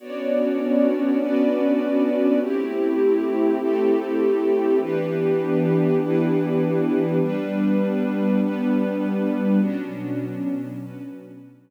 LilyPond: <<
  \new Staff \with { instrumentName = "Pad 2 (warm)" } { \time 4/4 \key b \phrygian \tempo 4 = 100 <b cis' d' fis'>1 | <a c' e' g'>1 | <e b d' g'>1 | <g b d'>1 |
<b, fis cis' d'>1 | }
  \new Staff \with { instrumentName = "String Ensemble 1" } { \time 4/4 \key b \phrygian <b fis' cis'' d''>2 <b fis' b' d''>2 | <a c' e' g'>2 <a c' g' a'>2 | <e d' g' b'>2 <e d' e' b'>2 | <g d' b'>2 <g b b'>2 |
<b cis' d' fis'>2 <b cis' fis' b'>2 | }
>>